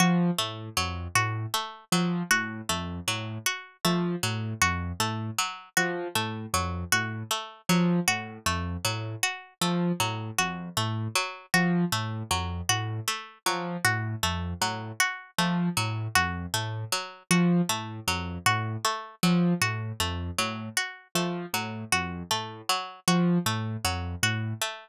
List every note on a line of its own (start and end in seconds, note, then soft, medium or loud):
0.00 0.31 F3 medium
0.00 0.31 F#4 medium
0.38 0.69 A2 medium
0.38 0.69 A3 medium
0.77 1.08 F2 medium
0.77 1.08 F#3 medium
1.15 1.46 A2 medium
1.15 1.46 F#4 medium
1.54 1.85 A3 medium
1.92 2.23 F3 medium
1.92 2.23 F#3 medium
2.31 2.62 A2 medium
2.31 2.62 F#4 medium
2.69 3.00 F2 medium
2.69 3.00 A3 medium
3.08 3.38 A2 medium
3.08 3.38 F#3 medium
3.46 3.77 F#4 medium
3.85 4.16 F3 medium
3.85 4.15 A3 medium
4.23 4.54 A2 medium
4.23 4.54 F#3 medium
4.62 4.93 F2 medium
4.62 4.92 F#4 medium
5.00 5.31 A2 medium
5.00 5.31 A3 medium
5.38 5.69 F#3 medium
5.77 6.08 F3 medium
5.77 6.08 F#4 medium
6.15 6.46 A2 medium
6.15 6.46 A3 medium
6.54 6.84 F2 medium
6.54 6.85 F#3 medium
6.92 7.23 A2 medium
6.92 7.23 F#4 medium
7.31 7.62 A3 medium
7.69 8.00 F3 medium
7.69 8.00 F#3 medium
8.08 8.38 A2 medium
8.08 8.38 F#4 medium
8.46 8.77 F2 medium
8.46 8.77 A3 medium
8.85 9.16 A2 medium
8.85 9.15 F#3 medium
9.23 9.54 F#4 medium
9.61 9.92 F3 medium
9.61 9.92 A3 medium
10.00 10.31 A2 medium
10.00 10.31 F#3 medium
10.38 10.69 F2 medium
10.38 10.69 F#4 medium
10.77 11.08 A2 medium
10.77 11.08 A3 medium
11.15 11.46 F#3 medium
11.54 11.85 F3 medium
11.54 11.85 F#4 medium
11.92 12.23 A2 medium
11.92 12.23 A3 medium
12.31 12.62 F2 medium
12.31 12.62 F#3 medium
12.69 13.00 A2 medium
12.69 13.00 F#4 medium
13.08 13.38 A3 medium
13.46 13.77 F3 medium
13.46 13.77 F#3 medium
13.85 14.15 A2 medium
13.85 14.15 F#4 medium
14.23 14.54 F2 medium
14.23 14.54 A3 medium
14.61 14.92 A2 medium
14.61 14.92 F#3 medium
15.00 15.31 F#4 medium
15.38 15.69 F3 medium
15.38 15.69 A3 medium
15.77 16.08 A2 medium
15.77 16.08 F#3 medium
16.15 16.46 F2 medium
16.15 16.46 F#4 medium
16.54 16.85 A2 medium
16.54 16.85 A3 medium
16.92 17.23 F#3 medium
17.31 17.61 F3 medium
17.31 17.62 F#4 medium
17.69 18.00 A2 medium
17.69 18.00 A3 medium
18.08 18.38 F2 medium
18.08 18.38 F#3 medium
18.46 18.77 A2 medium
18.46 18.77 F#4 medium
18.85 19.15 A3 medium
19.23 19.54 F3 medium
19.23 19.54 F#3 medium
19.62 19.92 A2 medium
19.62 19.92 F#4 medium
20.00 20.31 F2 medium
20.00 20.31 A3 medium
20.38 20.69 A2 medium
20.38 20.69 F#3 medium
20.77 21.08 F#4 medium
21.15 21.46 F3 medium
21.15 21.46 A3 medium
21.54 21.84 A2 medium
21.54 21.85 F#3 medium
21.92 22.23 F2 medium
21.92 22.23 F#4 medium
22.31 22.62 A2 medium
22.31 22.62 A3 medium
22.69 23.00 F#3 medium
23.08 23.38 F3 medium
23.08 23.38 F#4 medium
23.46 23.77 A2 medium
23.46 23.77 A3 medium
23.84 24.15 F2 medium
23.84 24.15 F#3 medium
24.23 24.54 A2 medium
24.23 24.54 F#4 medium
24.62 24.89 A3 medium